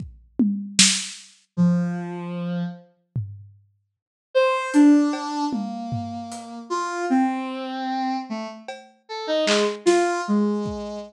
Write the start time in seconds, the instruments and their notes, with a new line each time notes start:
0.00 kick
0.39 high tom
0.79 snare
1.57 ocarina F3, floor tom
3.16 floor tom
4.35 ocarina C5
4.74 ocarina D4, closed hi-hat
5.13 cowbell
5.52 ocarina A#3, high tom
5.92 floor tom
6.32 closed hi-hat
6.70 ocarina F4
7.10 ocarina C4
8.29 ocarina A3
8.68 cowbell
9.09 ocarina A4
9.27 ocarina D#4
9.46 ocarina G#3, clap
9.86 ocarina F4, snare
10.28 ocarina G#3
10.66 kick